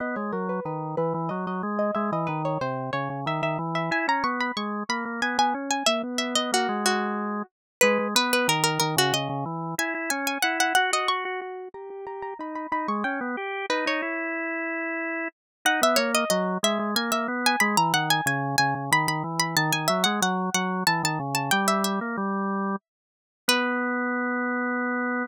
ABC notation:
X:1
M:3/4
L:1/16
Q:1/4=92
K:B
V:1 name="Pizzicato Strings"
d c A B B2 B2 d d z d | e d B c ^B2 c2 e e z e | g a c' b c'2 b2 g g z g | e z e d F2 F4 z2 |
[K:G#m] B2 B B A A A F d2 z2 | g2 g g f f f d c'2 z2 | a2 a a b b b c' =g2 z2 | B c9 z2 |
[K:B] f e c d d2 e2 g e z g | b a f g g2 g2 b b z b | =a g e f f2 f2 a a z a | =g e e8 z2 |
B12 |]
V:2 name="Drawbar Organ"
B, G, F,2 D,2 E, E, F, F, G,2 | G, E, D,2 ^B,,2 C, C, D, D, E,2 | E C B,2 G,2 A, A, B, B, C2 | A, B,2 B, A, G,5 z2 |
[K:G#m] G, G, B,2 D,2 D, C, C, C, E,2 | E E C2 E2 F F F F F2 | =G G G2 D2 D ^G, C B, =G2 | D D E8 z2 |
[K:B] D B, A,2 F,2 G, G, A, A, B,2 | G, E, D,2 C,2 C, C, D, D, E,2 | D, D, F, G, F,2 F,2 E, D, C,2 | =G,3 A, G,4 z4 |
B,12 |]